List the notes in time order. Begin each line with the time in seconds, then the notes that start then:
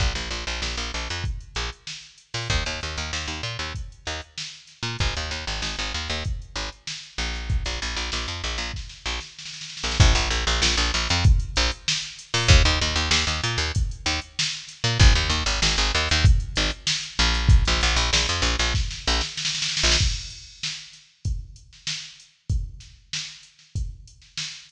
0.00 A#1, kick, closed hi-hat
0.15 A#1, closed hi-hat
0.31 A#1, closed hi-hat
0.47 A#1, closed hi-hat
0.62 A#1, snare
0.77 A#1, closed hi-hat
0.94 A#1, closed hi-hat
1.10 F2, closed hi-hat
1.24 kick, closed hi-hat
1.40 closed hi-hat
1.55 A#1, closed hi-hat
1.73 closed hi-hat
1.87 snare
2.03 closed hi-hat
2.18 closed hi-hat
2.34 A#2, snare, open hi-hat
2.50 D#2, kick, closed hi-hat
2.66 D#2, closed hi-hat
2.81 D#2, closed hi-hat
2.97 D#2, closed hi-hat
3.13 D#2, snare
3.27 D#2, closed hi-hat
3.43 A#2, closed hi-hat
3.59 D#2, closed hi-hat
3.75 kick, closed hi-hat
3.92 closed hi-hat
4.05 D#2, snare, closed hi-hat
4.22 closed hi-hat
4.38 snare
4.54 closed hi-hat
4.67 snare, closed hi-hat
4.83 A#2, snare, closed hi-hat
4.99 G#1, kick, closed hi-hat
5.15 D#2, closed hi-hat
5.31 D#2, snare, closed hi-hat
5.47 G#1, closed hi-hat
5.62 G#1, snare
5.79 G#1, closed hi-hat
5.94 D#2, closed hi-hat
6.09 D#2, closed hi-hat
6.25 kick, closed hi-hat
6.42 closed hi-hat
6.56 G#1, closed hi-hat
6.72 closed hi-hat
6.87 snare
7.03 snare, closed hi-hat
7.18 A#1, closed hi-hat
7.34 snare, closed hi-hat
7.49 kick, closed hi-hat
7.65 A#1, snare, closed hi-hat
7.82 A#1, closed hi-hat
7.96 A#1, closed hi-hat
8.12 A#1, snare
8.27 F2, closed hi-hat
8.43 A#1, closed hi-hat
8.58 A#1, closed hi-hat
8.74 kick, snare
8.89 snare
9.06 A#1, snare
9.20 snare
9.39 snare
9.45 snare
9.53 snare
9.61 snare
9.69 snare
9.77 snare
9.83 A#1, snare
9.91 snare
10.00 A#1, kick, closed hi-hat
10.15 A#1, closed hi-hat
10.30 A#1, closed hi-hat
10.47 A#1, closed hi-hat
10.62 A#1, snare
10.77 A#1, closed hi-hat
10.94 A#1, closed hi-hat
11.09 F2, closed hi-hat
11.24 kick, closed hi-hat
11.40 closed hi-hat
11.56 A#1, closed hi-hat
11.71 closed hi-hat
11.88 snare
12.02 closed hi-hat
12.19 closed hi-hat
12.34 A#2, snare, open hi-hat
12.48 D#2, kick, closed hi-hat
12.65 D#2, closed hi-hat
12.81 D#2, closed hi-hat
12.96 D#2, closed hi-hat
13.11 D#2, snare
13.27 D#2, closed hi-hat
13.43 A#2, closed hi-hat
13.58 D#2, closed hi-hat
13.75 kick, closed hi-hat
13.91 closed hi-hat
14.06 D#2, snare, closed hi-hat
14.21 closed hi-hat
14.39 snare
14.53 closed hi-hat
14.68 snare, closed hi-hat
14.84 A#2, snare, closed hi-hat
14.99 G#1, kick, closed hi-hat
15.15 D#2, closed hi-hat
15.30 D#2, snare, closed hi-hat
15.46 G#1, closed hi-hat
15.62 G#1, snare
15.77 G#1, closed hi-hat
15.94 D#2, closed hi-hat
16.09 D#2, closed hi-hat
16.24 kick, closed hi-hat
16.40 closed hi-hat
16.56 G#1, closed hi-hat
16.71 closed hi-hat
16.87 snare
17.03 snare, closed hi-hat
17.19 A#1, closed hi-hat
17.34 snare, closed hi-hat
17.49 kick, closed hi-hat
17.65 A#1, snare, closed hi-hat
17.81 A#1, closed hi-hat
17.96 A#1, closed hi-hat
18.13 A#1, snare
18.29 F2, closed hi-hat
18.42 A#1, closed hi-hat
18.59 A#1, closed hi-hat
18.74 kick, snare
18.91 snare
19.07 A#1, snare
19.21 snare
19.37 snare
19.45 snare
19.55 snare
19.62 snare
19.69 snare
19.77 snare
19.83 A#1, snare
19.91 snare
19.99 kick, crash
20.30 closed hi-hat
20.63 snare
20.93 snare, closed hi-hat
21.25 kick, closed hi-hat
21.56 closed hi-hat
21.73 snare
21.87 snare
22.20 closed hi-hat
22.49 kick, closed hi-hat
22.80 snare, closed hi-hat
23.13 snare
23.43 closed hi-hat
23.59 snare
23.76 kick, closed hi-hat
24.07 closed hi-hat
24.22 snare
24.38 snare
24.53 snare
24.69 closed hi-hat